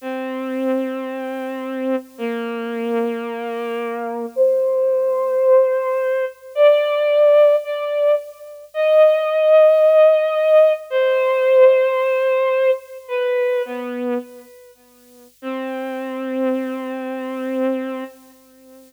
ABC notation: X:1
M:4/4
L:1/8
Q:1/4=110
K:Cm
V:1 name="Violin"
C8 | B,8 | c8 | d4 d2 z2 |
e8 | c8 | "^rit." =B2 =B,2 z4 | C8 |]